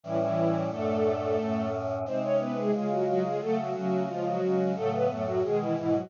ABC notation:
X:1
M:2/2
L:1/8
Q:1/2=89
K:F#m
V:1 name="String Ensemble 1"
[E,E] [E,E]3 | [A,A]6 z2 | [^B,^B] [Cc] [=B,=B] [G,G] [G,G] [F,F] [F,F] [G,G] | [A,A] [F,F] [F,F]2 [^E,^E] [F,F]3 |
[A,A] [B,B] [A,A] [F,F] [G,G] [E,E] [E,E] [F,F] |]
V:2 name="Choir Aahs"
[A,,E,=G,C]4 | [F,,A,,D]4 [F,,A,,C]4 | [^B,,G,^D]4 [C,G,^E]4 | [C,F,A,]2 [C,A,C]2 [C,^E,G,]2 [C,G,C]2 |
[A,,C,F,]2 [F,,A,,F,]2 [B,,^D,G,]2 [G,,B,,G,]2 |]